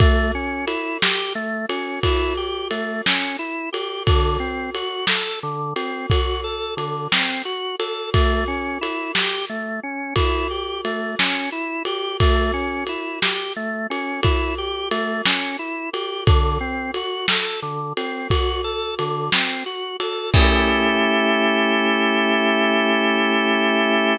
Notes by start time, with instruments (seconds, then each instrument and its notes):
0.00 drawbar organ A3, kick, ride
0.35 drawbar organ C#4
0.67 drawbar organ E4, ride
1.02 drawbar organ G4, snare
1.35 drawbar organ A3
1.69 drawbar organ C#4, ride
2.03 drawbar organ E4, kick, ride
2.37 drawbar organ G4
2.71 drawbar organ A3, ride
3.06 drawbar organ C#4, snare
3.39 drawbar organ E4
3.73 drawbar organ G4, ride
4.07 drawbar organ D3, kick, ride
4.40 drawbar organ C4
4.75 drawbar organ F#4, ride
5.07 drawbar organ A4, snare
5.43 drawbar organ D3
5.76 drawbar organ C4, ride
6.10 drawbar organ F#4, kick, ride
6.44 drawbar organ A4
6.77 drawbar organ D3, ride
7.12 drawbar organ C4, snare
7.45 drawbar organ F#4
7.79 drawbar organ A4, ride
8.14 drawbar organ A3, kick, ride
8.48 drawbar organ C#4
8.81 drawbar organ E4, ride
9.15 drawbar organ G4, snare
9.49 drawbar organ A3
9.83 drawbar organ C#4
10.16 drawbar organ E4, kick, ride
10.51 drawbar organ G4
10.85 drawbar organ A3, ride
11.19 drawbar organ C#4, snare
11.52 drawbar organ E4
11.85 drawbar organ G4, ride
12.20 drawbar organ A3, kick, ride
12.54 drawbar organ C#4
12.87 drawbar organ E4, ride
13.22 drawbar organ G4, snare
13.56 drawbar organ A3
13.90 drawbar organ C#4, ride
14.23 drawbar organ E4, kick, ride
14.58 drawbar organ G4
14.91 drawbar organ A3, ride
15.25 drawbar organ C#4, snare
15.59 drawbar organ E4
15.93 drawbar organ G4, ride
16.27 drawbar organ D3, kick, ride
16.61 drawbar organ C4
16.94 drawbar organ F#4, ride
17.28 drawbar organ A4, snare
17.62 drawbar organ D3
17.97 drawbar organ C4, ride
18.30 drawbar organ F#4, kick, ride
18.64 drawbar organ A4
18.99 drawbar organ D3, ride
19.32 drawbar organ C4, snare
19.66 drawbar organ F#4
20.00 drawbar organ A4, ride
20.34 drawbar organ A3 C#4 E4 G4, kick, crash